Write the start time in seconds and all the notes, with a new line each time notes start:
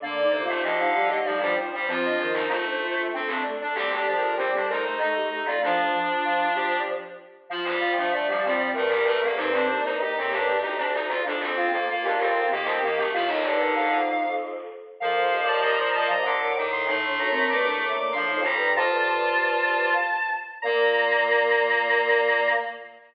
0.00 D3 A#3 D4 D5
0.16 D5
0.21 D#4
0.30 C3 C5
0.41 F4
0.48 A3
0.62 D3 F3 G4 D#5
0.79 D#4 F5
0.94 G3 G4 F5
1.08 A3 G4 D#5
1.24 F3 G3 D#4 D5
1.40 F3 G3 D4
1.57 F3 C5
1.73 G3
1.87 F3 C4 F4 C5
2.05 D4 D#5
2.17 D#3 C5
2.28 D#4
2.33 D#4
2.48 A3 F4
2.66 D4
2.81 A3 F4
2.96 A3 F4
3.12 A3 C4 D4
3.27 A3 C4 D4
3.45 A3
3.61 D4
3.75 G3 C4 G4
3.92 D4
3.96 A4
4.06 F3 D4
4.16 A#4
4.21 A#4
4.36 G3 C4 C5
4.54 D4 A4
4.68 A3 D#4 A#4 C5
4.84 A3 C5
4.98 A3 D#4 A4 D#5
5.16 A3 G4
5.30 A3
5.45 F4 D5
5.62 F3 D4 F4
5.93 F3
6.25 F4
6.55 G4
7.50 F3 F4
7.65 G3
7.81 F4
7.97 F3 A3 D4
8.12 A3 D5
8.27 F3 G3
8.44 F3 G3 C4
8.74 G2 A3 A#4
8.89 G3
9.05 A3
9.22 A#3 A4
9.37 G2 C4 D#4 C5
9.53 C4 D4
9.69 A#3
9.84 G2 D#4
9.98 D#4 G4
10.16 A2 C4
10.31 G2 D4
10.61 D2 D#4
10.77 D4
10.93 D#4
11.08 F4
11.24 F2 D4
11.40 C4
11.56 F4
11.71 F2 A#3 A4
11.88 A#3 F4
12.02 D#2 D4 G4
12.18 F2 C4 A#4
12.34 A#4
12.50 D#3 A#3 G4 A#4
12.64 C4 C5
12.80 A#3 A#4
12.96 A3 G4
13.13 A2 F3 F4 F5
13.27 D#3 D#4 D#5
13.42 G2 D3 D5
13.58 A#4
13.75 F2 F5
15.00 F2 F3 A#4 F5
15.21 C5
15.31 D#2
15.42 D5
15.48 A5
15.60 A#2 D#5 A#5
15.78 C5
15.93 A#2 D#5 A5
16.08 C3 D#5 A#5
16.23 A#2 D3 C5 D6
16.40 A2 A#4
16.56 A2 D#3
16.72 C6
16.87 A2 A3 D#4 C6
17.04 A2 D4 C6
17.19 F#2 A#5
17.30 C4
17.50 G2 A#3 D6
17.64 A2 D4 D6
17.81 A#3 D6
17.96 A#2 A#3 D6
18.12 A2 F3 D4 C6
18.29 F2 D#4
18.42 G3 A#5
18.55 G2
18.75 F2 F4 C5 A5
18.90 G2
19.07 A5
20.62 A#2 A#3 A#4 A#5